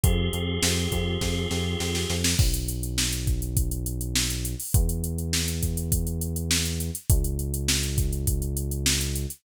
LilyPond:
<<
  \new Staff \with { instrumentName = "Drawbar Organ" } { \time 4/4 \key b \major \tempo 4 = 102 <c' f' g' aes'>1 | r1 | r1 | r1 | }
  \new Staff \with { instrumentName = "Synth Bass 1" } { \clef bass \time 4/4 \key b \major f,8 f,8 f,8 f,8 f,8 f,8 f,8 f,8 | b,,1 | e,1 | cis,1 | }
  \new DrumStaff \with { instrumentName = "Drums" } \drummode { \time 4/4 <hh bd>8 hh8 sn8 <hh bd>8 <bd sn>8 sn8 sn16 sn16 sn16 sn16 | <cymc bd>16 hh16 hh16 hh16 sn16 hh16 <hh bd>16 hh16 <hh bd>16 hh16 hh16 hh16 sn16 hh16 hh16 hho16 | <hh bd>16 hh16 hh16 hh16 sn16 hh16 <hh bd>16 hh16 <hh bd>16 hh16 hh16 hh16 sn16 hh16 hh16 hh16 | <hh bd>16 hh16 hh16 hh16 sn16 hh16 <hh bd>16 hh16 <hh bd>16 hh16 hh16 hh16 sn16 hh16 hh16 hh16 | }
>>